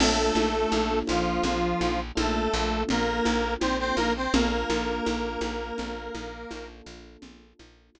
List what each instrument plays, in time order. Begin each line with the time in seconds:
0.00 electric bass (finger) A#1, lead 1 (square) A3 A4, electric piano 1 A#3 D4 F4 A4, crash, low conga
0.35 electric bass (finger) A#1, high conga
0.72 electric bass (finger) A#1, high conga
1.07 electric bass (finger) A#1, lead 1 (square) F3 F4, high conga
1.43 electric bass (finger) A#1, low conga
1.81 electric bass (finger) A#1, high conga
2.15 electric bass (finger) A#1, lead 1 (square) A3 A4, electric piano 1 A#3 D4 F4 A4, high conga
2.54 electric bass (finger) A#1
2.89 electric bass (finger) A#1, lead 1 (square) A#3 A#4, low conga
3.25 electric bass (finger) A#1, high conga
3.60 electric bass (finger) A#1, lead 1 (square) C4 C5, high conga
3.79 lead 1 (square) C4 C5
3.96 electric bass (finger) A#1, lead 1 (square) A#3 A#4, high conga
4.16 lead 1 (square) C4 C5
4.34 electric bass (finger) A#1, lead 1 (square) A#3 A#4, electric piano 1 A#3 D4 F4 A4, low conga
4.70 electric bass (finger) A#1, high conga
5.06 electric bass (finger) A#1, high conga
5.41 electric bass (finger) A#1, high conga
5.78 electric bass (finger) A#1, low conga
6.15 electric bass (finger) A#1, high conga
6.51 electric bass (finger) A#1, electric piano 1 A#3 D4 F4 A4, high conga
6.86 electric bass (finger) A#1
7.22 electric bass (finger) A#1, low conga
7.59 electric bass (finger) A#1, high conga
7.95 electric bass (finger) A#1, high conga